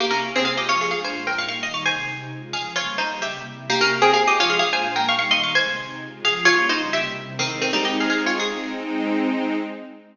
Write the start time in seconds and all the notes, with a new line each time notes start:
0.00 C3 A#3 E4 G4
0.11 C#4 A#4
0.23 C3 A#3 C4 G4
0.35 C4 G#4
0.45 G#3 C4 F4 G#4 F5
0.57 G4 D#5
0.69 F3 G#3 F4 C#5
0.81 G#4 F5
0.91 A#2 G#3 D4 F4 G#4 F5
1.04 C5 G#5
1.15 A#2 G#3 A#3 F4
1.27 A#4 G5
1.38 G3 A#3 D#4 F5 C#6
1.48 F5 C#6
1.62 D#3 G3 D#4 D#5 C6
1.74 F5 C#6
1.85 C3 G#3 D#4 C5 G#5
2.08 C3 C4 D#4
2.31 C#3 G#3 F4
2.53 C#3 F3 F4 G#4 F5
2.76 G3 A#3 C#4 F4 C#5
2.98 C#3 G3 C#4 D#4 C5
3.22 C3 G3 A#3 E4 G4 E5
3.47 C3 G3 C4 E4
3.69 C3 A#3 E4 G4
3.81 C#4 A#4
3.92 C3 A#3 C4 G4
4.02 C4 G#4
4.13 G#3 C4 F4 G#4 F5
4.27 G4 D#5
4.39 F3 G#3 F4 C#5
4.50 G#4 F5
4.59 A#2 G#3 D4 F4 G#4 F5
4.73 C5 G#5
4.85 A#2 G#3 A#3 F4
4.96 A#4 G5
5.08 G3 A#3 D#4 F5 C#6
5.19 F5 C#6
5.30 D#3 G3 D#4 D#5 C6
5.43 F5 C#6
5.54 C3 G#3 D#4 C5 G#5
5.77 C3 C4 D#4
6.00 C#3 G#3 F4
6.23 C#3 F3 F4 G#4 F5
6.45 G3 A#3 C#4 F4 C#5
6.69 C#3 G3 C#4 D#4 C5
6.92 C3 G3 A#3 E4 G4 E5
7.15 C3 G3 C4 E4
7.39 D#3 G#3 C4 D#4
7.61 D#3 C4
7.73 G3 D#4
7.85 G4 D#5
8.00 G#4 F5
8.10 G#4 F5
8.26 F4 C#5
8.39 G#3 C4 D#4 G#4